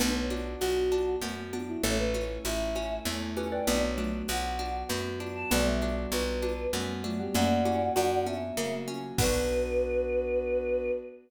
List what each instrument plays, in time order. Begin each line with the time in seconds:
0.00 electric bass (finger) B1, pizzicato strings B3, xylophone B3 D4, pad 2 (warm) B3 D4 F#4, choir aahs B4, cowbell, low conga
0.15 choir aahs C#5
0.30 pizzicato strings D4, high conga
0.60 electric bass (finger) B1, choir aahs F#4, pizzicato strings F#4, tambourine, cowbell, high conga
0.92 pad 2 (warm) F#3 B3 F#4, pizzicato strings D4, high conga
1.22 electric bass (finger) F#2, pizzicato strings B3, cowbell, low conga
1.53 xylophone B3 D4, pizzicato strings D4, high conga
1.67 choir aahs E4
1.83 electric bass (finger) A1, pizzicato strings A3, pad 2 (warm) A3 C#4 E4, xylophone A4 C#5, choir aahs C#5, cowbell, low conga
1.98 choir aahs B4
2.14 pizzicato strings C#4, high conga
2.45 electric bass (finger) A1, pizzicato strings E4, choir aahs E5, tambourine, cowbell, high conga
2.75 pad 2 (warm) A3 E4 A4, pizzicato strings C#4, high conga
3.05 electric bass (finger) E2, pizzicato strings A3, xylophone A4 C#5, cowbell, low conga
3.37 pizzicato strings C#4, xylophone G4 B4, high conga
3.52 xylophone B4 D5, choir aahs G5
3.67 electric bass (finger) B1, pizzicato strings B3, pad 2 (warm) B3 D4 F#4, xylophone B3 D4, choir aahs D5, cowbell, low conga
3.83 choir aahs C#5
3.98 xylophone F#3 A3, pizzicato strings D4, high conga
4.28 electric bass (finger) B1, pizzicato strings F#4, choir aahs F#5, tambourine, cowbell, high conga
4.59 pad 2 (warm) F#3 B3 F#4, pizzicato strings D4, high conga
4.89 electric bass (finger) F#2, pizzicato strings B3, cowbell, low conga
5.20 pizzicato strings D4, high conga
5.36 choir aahs A5
5.51 electric bass (finger) B1, xylophone G3 B3, pizzicato strings B3, pad 2 (warm) B3 D4 F#4, choir aahs D5, cowbell, low conga
5.66 choir aahs E5
5.82 pizzicato strings D4, high conga
6.12 electric bass (finger) B1, pizzicato strings F#4, choir aahs B4, tambourine, cowbell, high conga
6.42 pad 2 (warm) F#3 B3 F#4, pizzicato strings D4, high conga
6.73 electric bass (finger) F#2, xylophone G3 B3, pizzicato strings B3, cowbell, low conga
7.04 xylophone F#3 A3, pizzicato strings D4, high conga
7.19 xylophone G3 B3, choir aahs G4
7.34 electric bass (finger) F#2, pad 2 (warm) A#3 C#4 F#4, xylophone A#3 C#4, pizzicato strings A#3, choir aahs D5 F#5, cowbell, low conga
7.65 pizzicato strings C#4, xylophone E4 G4, high conga
7.96 electric bass (finger) F#2, xylophone D4 F#4, pizzicato strings F#4, tambourine, cowbell, high conga
8.26 pad 2 (warm) F#3 A#3 F#4, xylophone B3 D4, pizzicato strings C#4, choir aahs E5, high conga
8.57 electric bass (finger) C#3, pizzicato strings A#3, cowbell, low conga
8.88 pizzicato strings C#4, high conga
9.18 electric bass (finger) B1, pad 2 (warm) B3 D4 F#4, xylophone B3, pizzicato strings B3 D4, choir aahs B4, kick, crash
9.24 pizzicato strings F#4